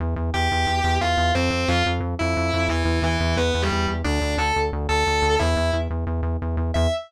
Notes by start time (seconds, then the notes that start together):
0.00 E2
0.16 E2
0.34 E2 G4 G5
0.52 E2
0.67 E2
0.84 E2
1.01 E2 F4 F5
1.17 E2
1.35 F2 C4 C5
1.51 F2
1.68 F2 F4 F5
1.86 F2
2.00 F2
2.19 F2 E4 E5
2.37 F2
2.54 F2
2.69 E2 E3 E4
2.85 E2
3.02 E2 E3 E4
3.20 E2
3.37 E2 B3 B4
3.55 E2
3.62 G3 G4
3.72 E2
3.88 E2
4.04 D2 D4 D5
4.21 D2
4.37 D2 A4 A5
4.56 D2
4.73 D2
4.89 D2 A4 A5
5.07 D2
5.22 D2
5.39 E2 E4 E5
5.57 E2
5.73 E2
5.90 E2
6.07 E2
6.23 E2
6.42 E2
6.57 E2
6.74 E2 E5